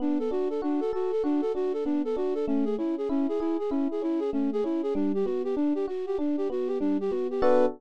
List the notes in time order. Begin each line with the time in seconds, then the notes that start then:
0.00 B3 D4
0.19 A4
0.31 D4 F#4
0.50 A4
0.62 D4 F#4
0.80 A4
0.93 F#4 A4
1.12 A4
1.24 D4 F#4
1.41 A4
1.55 D4 F#4
1.73 A4
1.85 B3 D4
2.05 A4
2.16 D4 F#4
2.35 A4
2.47 A3 C#4
2.65 G#4
2.78 C#4 E4
2.98 G#4
3.09 C#4 E4
3.29 G#4
3.40 E4 G#4
3.59 G#4
3.70 C#4 E4
3.91 G#4
4.02 C#4 E4
4.20 G#4
4.33 A3 C#4
4.53 G#4
4.64 C#4 E4
4.83 G#4
4.95 G3 D4
5.15 G4
5.25 B3 F#4
5.44 G4
5.56 D4
5.75 G4
5.88 F#4
6.06 G4
6.18 D4
6.37 G4
6.50 B3 F#4
6.68 G4
6.80 G3 D4
7.01 G4
7.10 B3 F#4
7.31 G4
7.42 B3 D4 F#4 A4 B4